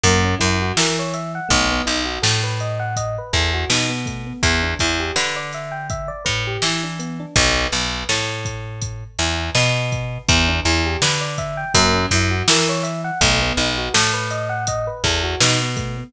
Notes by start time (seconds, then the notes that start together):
0.04 F#2 A#3, kick, closed hi-hat
0.24 C#4
0.39 F#2 E4, kick, closed hi-hat
0.62 F#4
0.77 E3 A#4, snare
0.99 C#5
1.14 E5, closed hi-hat
1.35 F#5
1.49 B1 A3, kick, closed hi-hat
1.71 B3
1.86 B1 D#4, closed hi-hat
2.05 F#4
2.22 A2 A4, snare
2.44 B4
2.60 D#5, closed hi-hat
2.80 F#5
2.96 D#5, kick, closed hi-hat
3.18 B4
3.33 E2 A4, kick, closed hi-hat
3.54 F#4
3.70 B2 D#4, snare
3.89 B3
4.06 A3, kick, closed hi-hat
4.26 B3
4.43 E2 B3, kick, closed hi-hat
4.63 D4
4.79 E2 E4, kick, closed hi-hat
5.00 G4
5.16 D3 B4, snare
5.36 D5
5.53 E5, snare, closed hi-hat
5.71 G5
5.90 E5, kick, closed hi-hat
6.08 D5
6.25 A2 B4, kick, closed hi-hat
6.47 G4
6.62 E3 E4, snare
6.83 D4
6.99 B3, closed hi-hat
7.20 D4
7.36 B1, kick, closed hi-hat
7.72 B1, closed hi-hat
8.09 A2, snare
8.45 kick, closed hi-hat
8.82 kick, closed hi-hat
9.19 E2, closed hi-hat
9.55 B2, snare
9.92 kick, closed hi-hat
10.28 E2 B3, kick, closed hi-hat
10.48 D4
10.65 E2 E4, closed hi-hat
10.86 G4
11.02 D3 B4, snare
11.21 D5
11.38 E5, kick, closed hi-hat
11.57 G5
11.74 F#2 A#3, kick, closed hi-hat
11.94 C#4
12.11 F#2 E4, kick, closed hi-hat
12.31 F#4
12.48 E3 A#4, snare
12.69 C#5
12.83 E5, closed hi-hat
13.04 F#5
13.21 B1 A3, kick, closed hi-hat
13.42 B3
13.57 B1 D#4, closed hi-hat
13.78 F#4
13.94 A2 A4, snare
14.13 B4
14.31 D#5, closed hi-hat
14.49 F#5
14.67 D#5, kick, closed hi-hat
14.87 B4
15.04 E2 A4, kick, closed hi-hat
15.23 F#4
15.40 B2 D#4, snare
15.61 B3
15.76 A3, kick, closed hi-hat
15.97 B3